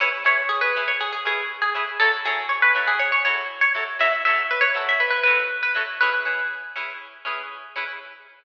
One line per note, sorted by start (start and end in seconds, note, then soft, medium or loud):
0.00 0.09 C#4 medium
0.00 0.09 E4 medium
0.00 0.09 G#4 medium
0.00 0.09 B4 medium
0.00 0.13 C#5 medium
0.24 0.42 C#4 medium
0.24 0.42 E4 medium
0.24 0.42 G#4 medium
0.24 0.42 B4 medium
0.24 0.49 C#5 medium
0.49 0.61 G#4 medium
0.61 0.81 B4 medium
0.76 0.93 C#4 medium
0.76 0.93 E4 medium
0.76 0.93 G#4 medium
0.76 0.93 B4 medium
0.88 1.00 C#5 medium
1.01 1.12 G#4 medium
1.12 1.24 G#4 medium
1.25 1.43 C#4 medium
1.25 1.43 E4 medium
1.25 1.61 G#4 medium
1.25 1.43 B4 medium
1.62 1.74 G#4 medium
1.74 1.83 C#4 medium
1.74 1.83 E4 medium
1.74 1.83 G#4 medium
1.74 1.83 B4 medium
2.00 2.09 F#3 medium
2.00 2.09 E4 medium
2.00 2.12 A4 medium
2.00 2.09 C#5 medium
2.25 2.42 F#3 medium
2.25 2.42 E4 medium
2.25 2.47 G#4 medium
2.25 2.42 A4 medium
2.25 2.42 C#5 medium
2.49 2.61 C#5 medium
2.62 2.85 B4 medium
2.75 2.92 F#3 medium
2.75 2.92 E4 medium
2.75 2.92 A4 medium
2.75 2.92 C#5 medium
2.88 2.99 G#4 medium
2.99 3.11 C#5 medium
3.12 3.24 C#5 medium
3.25 3.43 F#3 medium
3.25 3.43 E4 medium
3.25 3.43 A4 medium
3.25 3.57 C#5 medium
3.61 3.73 C#5 medium
3.75 3.83 F#3 medium
3.75 3.83 E4 medium
3.75 3.83 A4 medium
3.75 3.83 C#5 medium
3.99 4.08 F#3 medium
3.99 4.08 E4 medium
3.99 4.08 A4 medium
3.99 4.08 C#5 medium
3.99 4.12 E5 medium
4.25 4.42 F#3 medium
4.25 4.42 E4 medium
4.25 4.42 A4 medium
4.25 4.42 C#5 medium
4.25 4.47 E5 medium
4.51 4.62 B4 medium
4.61 4.84 C#5 medium
4.75 4.92 F#3 medium
4.75 4.92 E4 medium
4.75 4.92 A4 medium
4.75 4.92 C#5 medium
4.89 5.01 E5 medium
5.00 5.10 B4 medium
5.10 5.22 B4 medium
5.23 5.43 F#3 medium
5.23 5.43 E4 medium
5.23 5.43 A4 medium
5.23 5.54 B4 medium
5.28 5.43 C#5 medium
5.63 5.75 B4 medium
5.75 5.83 F#3 medium
5.75 5.83 E4 medium
5.75 5.83 A4 medium
5.75 5.83 C#5 medium
6.01 6.10 C#4 medium
6.01 6.10 E4 medium
6.01 6.10 G#4 medium
6.01 6.45 B4 medium
6.25 6.43 C#4 medium
6.25 6.43 E4 medium
6.25 6.43 G#4 medium
6.25 6.43 B4 medium
6.76 6.93 C#4 medium
6.76 6.93 E4 medium
6.76 6.93 G#4 medium
6.76 6.93 B4 medium
7.25 7.42 C#4 medium
7.25 7.42 E4 medium
7.25 7.42 G#4 medium
7.25 7.42 B4 medium
7.76 7.84 C#4 medium
7.76 7.84 E4 medium
7.76 7.84 G#4 medium
7.76 7.84 B4 medium